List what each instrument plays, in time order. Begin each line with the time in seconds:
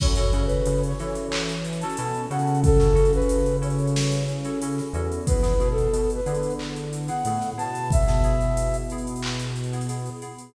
0.00 synth bass 1 F#2, electric piano 2 C#4 E4 F#4 A4, flute C#5, kick, crash
0.16 electric piano 2 C#4 E4 F#4 A4, snare, closed hi-hat
0.33 synth bass 1 C#3, electric piano 2 C#4 E4 F#4 A4, closed hi-hat
0.46 flute B4, closed hi-hat
0.66 synth bass 1 C#3, closed hi-hat
0.83 flute C#5, closed hi-hat
0.99 synth bass 1 E3, electric piano 2 C#4 E4 F#4 A4, snare, closed hi-hat
1.15 closed hi-hat
1.32 clap
1.49 snare, closed hi-hat
1.65 closed hi-hat
1.73 closed hi-hat
1.81 electric piano 2 C#4 E4 F#4 A4, flute A5, closed hi-hat
1.90 closed hi-hat
1.97 synth bass 1 B2, electric piano 2 C#4 E4 F#4 A4, closed hi-hat
2.14 closed hi-hat
2.30 synth bass 1 C#3, electric piano 2 C#4 E4 F#4 A4, flute F#5, closed hi-hat
2.39 closed hi-hat
2.47 closed hi-hat
2.55 closed hi-hat
2.64 flute A4, kick, closed hi-hat
2.79 electric piano 2 C#4 E4 F#4 A4, snare, closed hi-hat
2.95 electric piano 2 C#4 E4 F#4 A4, closed hi-hat
3.05 closed hi-hat
3.13 flute B4, closed hi-hat
3.22 closed hi-hat
3.29 closed hi-hat
3.46 closed hi-hat
3.62 electric piano 2 C#4 E4 F#4 A4, flute C#5, closed hi-hat
3.70 closed hi-hat
3.79 closed hi-hat
3.88 closed hi-hat
3.96 snare
4.12 closed hi-hat
4.28 closed hi-hat
4.45 electric piano 2 C#4 E4 F#4 A4, closed hi-hat
4.62 electric piano 2 C#4 E4 F#4 A4, closed hi-hat
4.78 snare, closed hi-hat
4.93 synth bass 1 E2, electric piano 2 C#4 E4 F#4 A4, closed hi-hat
5.12 closed hi-hat
5.27 electric piano 2 B3 E4 G#4, flute B4, kick, closed hi-hat
5.42 electric piano 2 B3 E4 G#4, snare, closed hi-hat
5.60 synth bass 1 B2, electric piano 2 B3 E4 G#4, closed hi-hat
5.71 flute A4
5.78 closed hi-hat
5.93 synth bass 1 B2, closed hi-hat
6.10 closed hi-hat
6.15 flute B4
6.26 synth bass 1 D3, electric piano 2 B3 E4 G#4, closed hi-hat
6.35 closed hi-hat
6.43 closed hi-hat
6.50 closed hi-hat
6.59 clap
6.76 closed hi-hat
6.93 closed hi-hat
7.08 electric piano 2 B3 E4 G#4, flute F#5, closed hi-hat
7.25 synth bass 1 A2, electric piano 2 B3 E4 G#4, closed hi-hat
7.41 snare, closed hi-hat
7.57 synth bass 1 B2, electric piano 2 B3 E4 G#4, flute A5, closed hi-hat
7.75 closed hi-hat
7.91 flute E5, kick, closed hi-hat
8.07 electric piano 2 B3 E4 G#4, snare, closed hi-hat
8.24 electric piano 2 B3 E4 G#4, closed hi-hat
8.41 closed hi-hat
8.57 closed hi-hat
8.74 closed hi-hat
8.90 electric piano 2 B3 E4 G#4, closed hi-hat
8.98 closed hi-hat
9.07 closed hi-hat
9.16 closed hi-hat
9.23 clap
9.39 closed hi-hat
9.56 closed hi-hat
9.64 closed hi-hat
9.73 electric piano 2 B3 E4 G#4, closed hi-hat
9.81 closed hi-hat
9.89 electric piano 2 B3 E4 G#4, closed hi-hat
10.06 closed hi-hat
10.22 electric piano 2 B3 E4 G#4, closed hi-hat
10.38 closed hi-hat